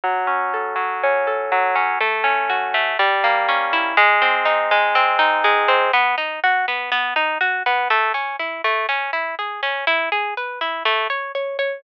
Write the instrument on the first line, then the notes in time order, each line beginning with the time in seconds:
orchestral harp
0.04 F#3
0.27 C#4
0.54 A4
0.76 F#3
1.03 C#4
1.27 A4
1.52 F#3
1.76 C#4
2.01 A3
2.24 C#4
2.50 F#4
2.74 A3
2.99 G3
3.24 A#3
3.49 C#4
3.73 E4
3.97 G#3
4.22 C4
4.45 D#4
4.71 G#3
4.95 C4
5.19 D#4
5.44 G#3
5.68 C4
5.93 B3
6.18 D#4
6.44 F#4
6.68 B3
6.92 B3
7.16 D#4
7.41 F#4
7.66 B3
7.90 A3
8.14 C#4
8.39 E4
8.64 A3
8.89 C#4
9.13 E4
9.39 G#4
9.63 C#4
9.87 E4
10.12 G#4
10.37 B4
10.61 E4
10.85 A3
11.10 C#5
11.35 C#5
11.59 C#5